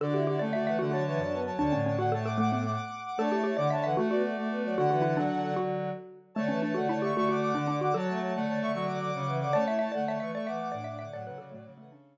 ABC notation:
X:1
M:12/8
L:1/8
Q:3/8=151
K:D
V:1 name="Ocarina"
[Fd]2 [Fd] [CA] [Fd] [Af] [Af] [ca] [ca]3 [ca] | [ca]2 [ca] [Af] [ca] [fd'] [fd'] [fd'] [fd']3 [fd'] | [ca]2 [ca] [fd'] [ca] [Af] [Af] [Fd] [Fd]3 [Fd] | [Af]7 z5 |
[ca]2 [ca] [Af] [ca] [ec'] [ec'] [fd'] [fd']3 [fd'] | [ca]2 [ca] [Af] [ca] [ec'] [ec'] [fd'] [fd']3 [fd'] | [ca]2 [ca] [Af] [ca] [ec'] [ec'] [fd'] [fd']3 [fd'] | [Af] [Af] [Fd] [Fd] [Fd] [Af] [CA]6 |]
V:2 name="Xylophone"
A G G d e e F F z4 | D C C F A A A, B, z4 | A G G d e e F F z4 | F F E D3 F5 z |
A, C D F E G F F2 D D F | A11 z | d e e d e e d e2 d e e | d B A A,2 A, D5 z |]
V:3 name="Choir Aahs"
D E E D, D, E, A, F, E, D B, F, | D,3 D, A,5 z3 | D E E D, D, E, A, B, A, A, B, F, | D, E,2 D, D, D, D,3 z3 |
D, E, E, D, D, D, D, D, D, D, D, D, | F, A, A, D, D, D, D, D, D, F, E, D, | C E E D, D, E, A, E, E, D D D, | F,5 E, C,3 z3 |]
V:4 name="Lead 1 (square)"
D,3 A,3 D,3 F,,3 | D,, A,,9 z2 | A,3 D,3 A,3 A,3 | D,3 F,6 z3 |
A,3 A,3 A,3 D,3 | F,3 A,3 F,3 C,3 | A,3 A,3 A,3 A,,3 | A,, C, C, A,, C,6 z2 |]